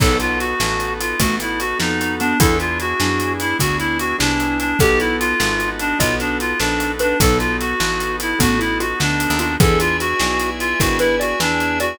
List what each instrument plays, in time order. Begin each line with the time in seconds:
0.00 electric bass (finger) B1, acoustic grand piano B3 D#4 F#4 A4, drawbar organ B3 D#4 F#4 A4, xylophone D#4, clarinet A4, kick, crash
0.20 clarinet F4, closed hi-hat
0.39 clarinet F#4, closed hi-hat
0.60 electric bass (finger) A1, acoustic grand piano B3 D#4 F#4 A4, snare
0.80 closed hi-hat
1.00 clarinet F4, closed hi-hat
1.20 electric bass (finger) A1, xylophone A3, acoustic grand piano B3 D#4 F#4 A4, clarinet F#4, kick, closed hi-hat
1.40 clarinet E4, closed hi-hat
1.60 clarinet F#4, closed hi-hat
1.79 electric bass (finger) F2, acoustic grand piano B3 D#4 F#4 A4, clarinet D#4, snare
2.01 closed hi-hat
2.20 xylophone B3, clarinet D4, closed hi-hat
2.40 electric bass (finger) E2, drawbar organ B3 D4 E4 G#4, acoustic grand piano B3 D4 E4 G#4, xylophone E4, clarinet A4, kick, closed hi-hat
2.60 clarinet F4, closed hi-hat
2.80 clarinet F#4, closed hi-hat
3.00 electric bass (finger) F#2, acoustic grand piano B3 D4 E4 G#4, xylophone D4, snare
3.20 closed hi-hat
3.40 clarinet E4, closed hi-hat
3.59 electric bass (finger) D2, acoustic grand piano B3 D4 E4 G#4, clarinet F#4, kick, closed hi-hat
3.79 clarinet E4, closed hi-hat
3.99 clarinet F#4, closed hi-hat
4.18 electric bass (finger) C2, acoustic grand piano B3 D4 E4 G#4, clarinet D4, snare
4.40 closed hi-hat
4.60 clarinet D4, closed hi-hat
4.79 electric bass (finger) B1, drawbar organ B3 D#4 F#4 A4, acoustic grand piano B3 D#4 F#4 A4, clarinet G4, xylophone A4, kick, closed hi-hat
5.00 clarinet E4, closed hi-hat
5.20 clarinet F4, closed hi-hat
5.40 electric bass (finger) G#1, acoustic grand piano B3 D#4 F#4 A4, snare
5.60 closed hi-hat
5.79 clarinet D4, closed hi-hat
5.99 electric bass (finger) B1, acoustic grand piano B3 D#4 F#4 A4, clarinet F4, xylophone D#5, kick, closed hi-hat
6.20 clarinet D4, closed hi-hat
6.40 clarinet F4, closed hi-hat
6.59 electric bass (finger) A#1, acoustic grand piano B3 D#4 F#4 A4, clarinet D4, snare
6.80 closed hi-hat
6.99 clarinet D4, xylophone B4, closed hi-hat
7.20 electric bass (finger) B1, drawbar organ B3 D#4 F#4 A4, acoustic grand piano B3 D#4 F#4 A4, xylophone D#4, clarinet A4, kick, closed hi-hat
7.39 clarinet F4, closed hi-hat
7.60 clarinet F#4, closed hi-hat
7.80 electric bass (finger) A1, acoustic grand piano B3 D#4 F#4 A4, snare
8.00 closed hi-hat
8.20 clarinet E4, closed hi-hat
8.39 electric bass (finger) A1, acoustic grand piano B3 D#4 F#4 A4, xylophone B3, clarinet F#4, kick, closed hi-hat
8.59 xylophone E4, clarinet E4, closed hi-hat
8.80 xylophone F4, clarinet F#4, closed hi-hat
9.00 electric bass (finger) D2, acoustic grand piano B3 D#4 F#4 A4, clarinet D4, snare
9.20 closed hi-hat
9.30 electric bass (finger) D#2
9.39 clarinet D4, xylophone F4, closed hi-hat
9.60 electric bass (finger) E2, acoustic grand piano B3 D4 E4 G#4, xylophone G#4, clarinet A4, drawbar organ B4 D5 E5 G#5, kick, closed hi-hat
9.80 clarinet F4, closed hi-hat
10.00 clarinet F#4, closed hi-hat
10.20 electric bass (finger) B1, acoustic grand piano B3 D4 E4 G#4, snare
10.40 closed hi-hat
10.60 clarinet F4, closed hi-hat
10.80 electric bass (finger) G#1, acoustic grand piano B3 D4 E4 G#4, xylophone E4, clarinet F#4, kick, closed hi-hat
10.99 clarinet E4, xylophone B4, closed hi-hat
11.20 clarinet F#4, xylophone D5, closed hi-hat
11.40 electric bass (finger) E2, acoustic grand piano B3 D4 E4 G#4, clarinet D4, snare
11.60 closed hi-hat
11.80 clarinet F#4, xylophone D5, closed hi-hat